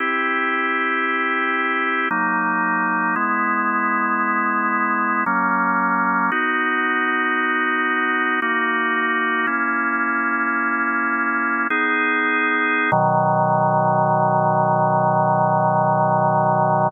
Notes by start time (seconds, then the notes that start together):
0.00 C4 E4 G4
2.11 F#3 A#3 D#4
3.16 G#3 B3 E4
5.26 F#3 A#3 C#4
6.32 B3 D#4 F#4
8.42 A#3 D#4 F#4
9.47 A#3 C#4 E4
11.70 B3 D#4 G#4
12.92 B2 D#3 F#3